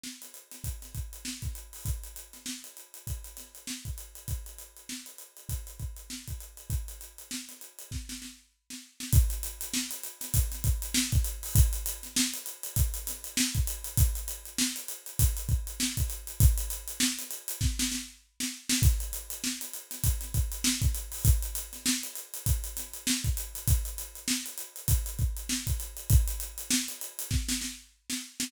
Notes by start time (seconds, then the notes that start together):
0.04 snare
0.22 snare, closed hi-hat
0.34 closed hi-hat
0.52 snare, closed hi-hat
0.64 kick, closed hi-hat
0.82 snare, closed hi-hat
0.95 kick, closed hi-hat
1.13 closed hi-hat
1.25 snare
1.42 kick, snare, closed hi-hat
1.55 closed hi-hat
1.73 open hi-hat
1.85 kick, closed hi-hat
2.04 closed hi-hat
2.16 closed hi-hat
2.33 snare, closed hi-hat
2.46 snare
2.64 closed hi-hat
2.77 closed hi-hat
2.94 closed hi-hat
3.07 kick, closed hi-hat
3.24 closed hi-hat
3.37 snare, closed hi-hat
3.55 closed hi-hat
3.67 snare
3.85 kick, closed hi-hat
3.98 closed hi-hat
4.15 closed hi-hat
4.28 kick, closed hi-hat
4.46 closed hi-hat
4.59 closed hi-hat
4.77 closed hi-hat
4.89 snare
5.06 closed hi-hat
5.18 closed hi-hat
5.37 closed hi-hat
5.49 kick, closed hi-hat
5.67 closed hi-hat
5.80 kick, closed hi-hat
5.97 closed hi-hat
6.10 snare
6.28 kick, closed hi-hat
6.41 closed hi-hat
6.57 closed hi-hat
6.70 kick, closed hi-hat
6.88 closed hi-hat
7.01 closed hi-hat
7.18 closed hi-hat
7.31 snare
7.49 snare, closed hi-hat
7.61 closed hi-hat
7.79 closed hi-hat
7.91 kick, snare
8.09 snare
8.22 snare
8.70 snare
9.00 snare
9.13 kick, closed hi-hat
9.30 closed hi-hat
9.43 closed hi-hat
9.61 closed hi-hat
9.74 snare
9.91 snare, closed hi-hat
10.04 closed hi-hat
10.21 snare, closed hi-hat
10.34 kick, closed hi-hat
10.52 snare, closed hi-hat
10.64 kick, closed hi-hat
10.82 closed hi-hat
10.94 snare
11.12 kick, snare, closed hi-hat
11.24 closed hi-hat
11.43 open hi-hat
11.55 kick, closed hi-hat
11.73 closed hi-hat
11.86 closed hi-hat
12.03 snare, closed hi-hat
12.16 snare
12.34 closed hi-hat
12.46 closed hi-hat
12.63 closed hi-hat
12.76 kick, closed hi-hat
12.94 closed hi-hat
13.07 snare, closed hi-hat
13.24 closed hi-hat
13.37 snare
13.55 kick, closed hi-hat
13.67 closed hi-hat
13.84 closed hi-hat
13.97 kick, closed hi-hat
14.15 closed hi-hat
14.28 closed hi-hat
14.45 closed hi-hat
14.58 snare
14.76 closed hi-hat
14.88 closed hi-hat
15.06 closed hi-hat
15.19 kick, closed hi-hat
15.37 closed hi-hat
15.49 kick, closed hi-hat
15.67 closed hi-hat
15.80 snare
15.97 kick, closed hi-hat
16.10 closed hi-hat
16.27 closed hi-hat
16.40 kick, closed hi-hat
16.58 closed hi-hat
16.70 closed hi-hat
16.88 closed hi-hat
17.00 snare
17.19 snare, closed hi-hat
17.31 closed hi-hat
17.48 closed hi-hat
17.61 kick, snare
17.79 snare
17.92 snare
18.40 snare
18.69 snare
18.82 kick, closed hi-hat
19.00 closed hi-hat
19.13 closed hi-hat
19.30 closed hi-hat
19.44 snare
19.61 snare, closed hi-hat
19.73 closed hi-hat
19.91 snare, closed hi-hat
20.04 kick, closed hi-hat
20.21 snare, closed hi-hat
20.34 kick, closed hi-hat
20.52 closed hi-hat
20.64 snare
20.82 kick, snare, closed hi-hat
20.95 closed hi-hat
21.12 open hi-hat
21.25 kick, closed hi-hat
21.43 closed hi-hat
21.55 closed hi-hat
21.73 snare, closed hi-hat
21.86 snare
22.03 closed hi-hat
22.16 closed hi-hat
22.34 closed hi-hat
22.46 kick, closed hi-hat
22.64 closed hi-hat
22.77 snare, closed hi-hat
22.94 closed hi-hat
23.07 snare
23.24 kick, closed hi-hat
23.37 closed hi-hat
23.55 closed hi-hat
23.68 kick, closed hi-hat
23.85 closed hi-hat
23.98 closed hi-hat
24.15 closed hi-hat
24.28 snare
24.46 closed hi-hat
24.58 closed hi-hat
24.76 closed hi-hat
24.88 kick, closed hi-hat
25.06 closed hi-hat
25.19 kick, closed hi-hat
25.37 closed hi-hat
25.49 snare
25.67 kick, closed hi-hat
25.80 closed hi-hat
25.97 closed hi-hat
26.10 kick, closed hi-hat
26.28 closed hi-hat
26.40 closed hi-hat
26.58 closed hi-hat
26.71 snare
26.88 snare, closed hi-hat
27.01 closed hi-hat
27.19 closed hi-hat
27.31 kick, snare
27.49 snare
27.61 snare
28.10 snare
28.40 snare